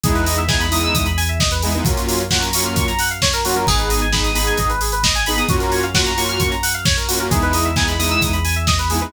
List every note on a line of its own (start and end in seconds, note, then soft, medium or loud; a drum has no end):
0.04 0.87 E2 medium
0.04 0.41 G#3 medium
0.04 0.41 B3 medium
0.04 0.41 D#4 loud
0.04 0.41 E4 medium
0.04 0.14 G#4 medium
0.04 kick loud
0.04 closed hi-hat loud
0.15 0.25 B4 medium
0.15 closed hi-hat medium
0.26 0.37 D#5 medium
0.26 open hi-hat medium
0.37 0.48 E5 medium
0.37 closed hi-hat medium
0.48 0.66 G#3 medium
0.48 0.66 B3 medium
0.48 0.66 D#4 medium
0.48 0.66 E4 medium
0.48 0.59 G#5 medium
0.48 kick loud
0.48 snare loud
0.60 0.71 B5 medium
0.60 closed hi-hat medium
0.71 1.07 G#3 medium
0.71 1.07 B3 medium
0.71 1.07 D#4 medium
0.71 1.07 E4 medium
0.71 0.82 D#6 medium
0.71 open hi-hat medium
0.82 0.93 E6 medium
0.82 closed hi-hat medium
0.94 1.78 E2 medium
0.94 1.05 D#6 medium
0.94 kick medium
0.94 closed hi-hat loud
1.06 1.16 B5 medium
1.06 closed hi-hat medium
1.17 1.27 G#5 medium
1.17 open hi-hat medium
1.29 1.39 E5 medium
1.29 closed hi-hat medium
1.40 1.50 D#5 medium
1.40 kick loud
1.40 snare loud
1.51 1.62 B4 medium
1.51 closed hi-hat medium
1.62 1.73 G#3 medium
1.62 1.73 B3 medium
1.62 1.73 D#4 medium
1.62 1.73 E4 medium
1.62 1.73 G#4 medium
1.62 open hi-hat medium
1.74 1.84 G#3 medium
1.74 1.84 B3 medium
1.74 1.84 D#4 medium
1.74 1.84 E4 medium
1.74 1.84 B4 medium
1.74 closed hi-hat medium
1.85 2.69 F#2 medium
1.85 2.22 F#3 medium
1.85 2.22 A#3 medium
1.85 2.22 C#4 medium
1.85 2.22 F4 loud
1.85 1.96 F#4 medium
1.85 kick loud
1.85 closed hi-hat loud
1.97 2.07 A#4 medium
1.97 closed hi-hat medium
2.08 2.18 C#5 medium
2.08 open hi-hat medium
2.20 2.30 F5 medium
2.20 closed hi-hat medium
2.30 2.49 F#3 medium
2.30 2.49 A#3 medium
2.30 2.49 C#4 medium
2.30 2.49 F4 medium
2.30 2.41 F#5 medium
2.30 kick medium
2.30 snare loud
2.42 2.52 A#5 medium
2.42 closed hi-hat medium
2.53 2.91 F#3 medium
2.53 2.91 A#3 medium
2.53 2.91 C#4 medium
2.53 2.91 F4 medium
2.53 2.64 C#6 medium
2.53 open hi-hat loud
2.65 2.75 F6 medium
2.65 closed hi-hat medium
2.76 3.60 F#2 medium
2.76 2.86 C#6 medium
2.76 kick loud
2.76 closed hi-hat loud
2.88 2.98 A#5 medium
2.88 closed hi-hat medium
2.99 3.09 F#5 medium
2.99 open hi-hat medium
3.11 3.21 F5 medium
3.11 closed hi-hat medium
3.22 3.32 C#5 medium
3.22 kick medium
3.22 snare loud
3.33 3.43 A#4 medium
3.33 closed hi-hat medium
3.45 3.54 F#3 medium
3.45 3.54 A#3 medium
3.45 3.54 C#4 medium
3.45 3.54 F4 medium
3.45 3.55 F#4 medium
3.45 open hi-hat medium
3.55 3.64 F#3 medium
3.55 3.64 A#3 medium
3.55 3.64 C#4 medium
3.55 3.64 F4 medium
3.55 3.66 A#4 medium
3.55 closed hi-hat medium
3.67 4.51 G#1 medium
3.67 4.05 B3 medium
3.67 4.05 D#4 medium
3.67 3.77 G#4 medium
3.67 4.05 G#4 medium
3.67 kick loud
3.67 crash loud
3.78 3.89 B4 medium
3.78 closed hi-hat medium
3.90 4.00 D#5 medium
3.90 open hi-hat medium
4.01 4.12 G#5 medium
4.01 closed hi-hat medium
4.12 4.30 B3 medium
4.12 4.30 D#4 medium
4.12 4.30 G#4 medium
4.12 4.23 B5 medium
4.12 kick medium
4.12 snare loud
4.24 4.34 D#6 medium
4.24 closed hi-hat medium
4.34 4.71 B3 medium
4.34 4.71 D#4 medium
4.34 4.71 G#4 medium
4.34 4.46 B5 medium
4.34 open hi-hat medium
4.47 4.57 G#5 medium
4.47 closed hi-hat medium
4.57 5.42 G#1 medium
4.57 4.68 D#5 medium
4.57 kick medium
4.57 closed hi-hat loud
4.69 4.80 B4 medium
4.69 closed hi-hat medium
4.81 4.91 G#4 medium
4.81 open hi-hat medium
4.92 5.02 B4 medium
4.92 closed hi-hat medium
5.03 5.14 D#5 medium
5.03 kick medium
5.03 snare loud
5.15 5.25 G#5 medium
5.15 closed hi-hat medium
5.26 5.36 B3 medium
5.26 5.36 D#4 medium
5.26 5.36 G#4 medium
5.26 5.37 B5 medium
5.26 open hi-hat medium
5.36 5.46 B3 medium
5.36 5.46 D#4 medium
5.36 5.46 G#4 medium
5.36 5.48 D#6 medium
5.36 closed hi-hat medium
5.48 6.33 F#2 medium
5.48 5.85 A#3 loud
5.48 5.85 C#4 medium
5.48 5.85 F4 medium
5.48 5.59 F#4 medium
5.48 5.85 F#4 medium
5.48 kick loud
5.48 closed hi-hat loud
5.60 5.71 A#4 medium
5.60 closed hi-hat medium
5.72 5.82 C#5 medium
5.72 open hi-hat medium
5.83 5.93 F5 medium
5.83 closed hi-hat medium
5.94 6.12 A#3 medium
5.94 6.12 C#4 medium
5.94 6.12 F4 medium
5.94 6.12 F#4 medium
5.94 6.05 F#5 medium
5.94 kick medium
5.94 snare loud
6.05 6.16 A#5 medium
6.05 closed hi-hat medium
6.17 6.54 A#3 medium
6.17 6.54 C#4 medium
6.17 6.54 F4 medium
6.17 6.54 F#4 medium
6.17 6.27 C#6 medium
6.17 open hi-hat medium
6.29 6.39 F6 medium
6.29 closed hi-hat medium
6.40 7.24 F#2 medium
6.40 6.50 C#6 medium
6.40 kick medium
6.40 closed hi-hat loud
6.51 6.62 A#5 medium
6.51 closed hi-hat medium
6.63 6.73 F#5 medium
6.63 open hi-hat loud
6.74 6.84 F5 medium
6.74 closed hi-hat medium
6.85 6.96 C#5 medium
6.85 kick loud
6.85 snare loud
6.97 7.07 A#4 medium
6.97 closed hi-hat medium
7.08 7.19 A#3 medium
7.08 7.19 C#4 medium
7.08 7.19 F4 medium
7.08 7.18 F#4 medium
7.08 7.19 F#4 medium
7.08 open hi-hat loud
7.19 7.29 A#3 medium
7.19 7.29 C#4 medium
7.19 7.29 F4 medium
7.19 7.29 F#4 medium
7.19 7.30 A#4 medium
7.19 closed hi-hat medium
7.31 8.15 E2 medium
7.31 7.68 G#3 medium
7.31 7.68 B3 medium
7.31 7.68 D#4 loud
7.31 7.68 E4 medium
7.31 7.41 G#4 medium
7.31 kick loud
7.31 closed hi-hat loud
7.42 7.52 B4 medium
7.42 closed hi-hat medium
7.53 7.64 D#5 medium
7.53 open hi-hat medium
7.65 7.75 E5 medium
7.65 closed hi-hat medium
7.76 7.94 G#3 medium
7.76 7.94 B3 medium
7.76 7.94 D#4 medium
7.76 7.94 E4 medium
7.76 7.87 G#5 medium
7.76 kick loud
7.76 snare loud
7.88 7.98 B5 medium
7.88 closed hi-hat medium
7.99 8.35 G#3 medium
7.99 8.35 B3 medium
7.99 8.35 D#4 medium
7.99 8.35 E4 medium
7.99 8.09 D#6 medium
7.99 open hi-hat medium
8.11 8.21 E6 medium
8.11 closed hi-hat medium
8.21 9.05 E2 medium
8.21 8.32 D#6 medium
8.21 kick medium
8.21 closed hi-hat loud
8.33 8.43 B5 medium
8.33 closed hi-hat medium
8.45 8.55 G#5 medium
8.45 open hi-hat medium
8.56 8.66 E5 medium
8.56 closed hi-hat medium
8.67 8.77 D#5 medium
8.67 kick loud
8.67 snare loud
8.79 8.89 B4 medium
8.79 closed hi-hat medium
8.90 9.00 G#3 medium
8.90 9.00 B3 medium
8.90 9.00 D#4 medium
8.90 9.00 E4 medium
8.90 9.00 G#4 medium
8.90 open hi-hat medium
9.01 9.10 G#3 medium
9.01 9.10 B3 medium
9.01 9.10 D#4 medium
9.01 9.10 E4 medium
9.01 9.12 B4 medium
9.01 closed hi-hat medium